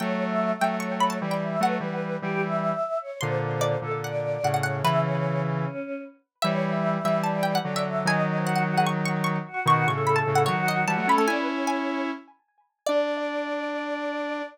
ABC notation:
X:1
M:4/4
L:1/16
Q:1/4=149
K:D
V:1 name="Harpsichord"
g3 z3 g2 c'2 b a2 g3 | f12 z4 | =c'4 d4 f4 f f f2 | B8 z8 |
e3 z3 e2 a2 g f2 e3 | ^g4 f f2 f c'2 c'2 c'4 | c'2 c'2 b a2 f c2 ^d2 a2 b a | ^g4 g8 z4 |
d16 |]
V:2 name="Choir Aahs"
(3c4 e4 e4 c4 d2 e2 | B2 B4 G2 e6 c2 | =c2 c4 A2 d6 ^c2 | e2 c4 z2 C4 z4 |
(3c4 e4 e4 d4 d2 e2 | ^d2 d ^B F2 F ^G z6 F2 | (3F4 A4 A4 F4 F2 A2 | d B c6 z8 |
d16 |]
V:3 name="Lead 1 (square)"
[F,A,]6 [F,A,]6 [E,G,]4 | [F,A,]2 [E,G,]4 [E,G,]6 z4 | [_B,,D,]6 [B,,D,]6 [A,,C,]4 | [C,E,]10 z6 |
[E,G,]6 [E,G,]6 [D,F,]4 | [^D,F,]16 | [B,,^D,]2 [A,,C,]4 [A,,C,]2 [D,F,]4 [E,G,] [F,A,] [A,C] [A,C] | [CE]10 z6 |
D16 |]